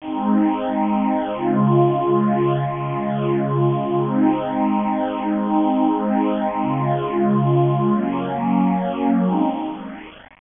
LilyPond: \new Staff { \time 9/8 \key aes \mixolydian \tempo 4. = 136 <aes c' ees'>1~ <aes c' ees'>8 | <des aes f'>1~ <des aes f'>8 | <des aes f'>1~ <des aes f'>8 | <aes c' ees'>1~ <aes c' ees'>8 |
<aes c' ees'>1~ <aes c' ees'>8 | <des aes f'>1~ <des aes f'>8 | <ges bes des'>1~ <ges bes des'>8 | <aes c' ees'>4. r2. | }